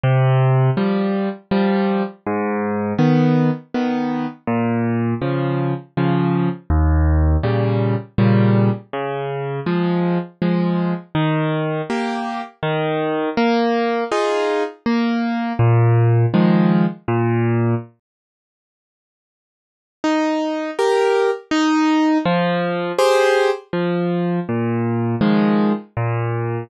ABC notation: X:1
M:3/4
L:1/8
Q:1/4=81
K:Ab
V:1 name="Acoustic Grand Piano"
C,2 [F,G,]2 [F,G,]2 | A,,2 [E,_C]2 [E,C]2 | B,,2 [D,F,]2 [D,F,]2 | E,,2 [B,,D,G,]2 [B,,D,G,]2 |
D,2 [F,A,]2 [F,A,]2 | [K:Eb] E,2 [B,G]2 E,2 | B,2 [EFA]2 B,2 | B,,2 [E,F,A,]2 B,,2 |
z6 | E2 [GB]2 E2 | F,2 [GAc]2 F,2 | B,,2 [E,F,A,]2 B,,2 |]